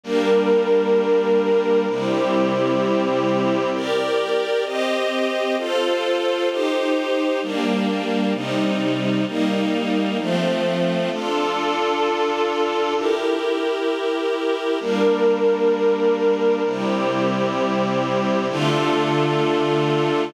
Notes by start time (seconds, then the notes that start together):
0.03 G3 A#3 D4 A#4
1.87 C3 G3 C4 E4 G4
3.73 G4 A#4 D5
4.65 C4 G4 D#5
5.58 F4 A4 C5
6.49 D#4 G4 C5
7.42 G3 A#3 D4
8.34 C3 G3 D#4
9.27 G3 A#3 D#4
10.19 F3 A3 C4
11.11 D4 F4 A4
12.96 E4 G4 A#4
14.80 G3 A#3 D4 A#4
16.65 C3 G3 C4 E4 G4
18.49 D3 A3 D4 F4 A4